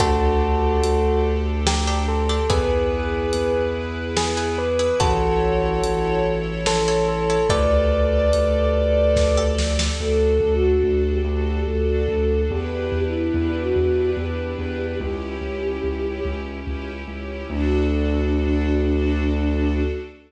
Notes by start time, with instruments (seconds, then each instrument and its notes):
0.00 synth bass 2 D2, string ensemble 1 D4 G4 A4, pizzicato strings D4 G4 A4, tubular bells F#4 A4, kick, closed hi-hat
0.83 synth bass 2 D2, closed hi-hat
1.67 tubular bells G4, snare
1.87 pizzicato strings D4 G4 A4
2.08 tubular bells A4
2.29 pizzicato strings D4 G4 A4
2.49 synth bass 2 E2, pizzicato strings E4 G#4 B4, string ensemble 1 E4 G#4 B4, tubular bells G#4 B4, kick, closed hi-hat
3.33 synth bass 2 E2, closed hi-hat
4.17 tubular bells G#4, snare
4.37 pizzicato strings E4 G#4 B4
4.58 tubular bells B4
4.79 pizzicato strings E4 G#4 B4
5.00 synth bass 2 A1, pizzicato strings E4 A4 C#5, string ensemble 1 E4 A4 C#5, tubular bells F#4 A4, kick, closed hi-hat
5.84 synth bass 2 A1, closed hi-hat
6.66 tubular bells A4, snare
6.88 pizzicato strings E4 A4 C#5
7.08 tubular bells A4
7.30 pizzicato strings E4 A4 C#5
7.49 synth bass 2 D2, string ensemble 1 G4 A4 D5, pizzicato strings G4 A4 D5, tubular bells B4 D5, kick, closed hi-hat
8.33 synth bass 2 D2, closed hi-hat
9.16 kick, snare
9.37 pizzicato strings G4 A4 D5
9.58 snare
9.79 pizzicato strings G4 A4 D5, snare
10.00 synth bass 2 D2, string ensemble 1 D4 F#4 A4, flute A4
10.40 synth bass 2 D2
10.56 flute F#4
10.84 synth bass 2 D2
11.11 flute G4
11.24 synth bass 2 D2
11.67 synth bass 2 D2, flute A4
12.08 synth bass 2 D2
12.50 synth bass 2 E2, string ensemble 1 D4 E4 G4 B4, flute G4
12.92 synth bass 2 E2
13.06 flute E4
13.34 synth bass 2 E2
13.61 flute F#4
13.76 synth bass 2 E2
14.17 synth bass 2 E2, flute G4
14.59 synth bass 2 E2
15.00 synth bass 2 C#2, string ensemble 1 C#4 E4 G4, flute G4
15.41 synth bass 2 C#2
15.84 synth bass 2 C#2
16.25 synth bass 2 C#2
16.67 synth bass 2 C#2
17.07 synth bass 2 C#2
17.50 synth bass 2 D2, flute D4, string ensemble 1 D4 F#4 A4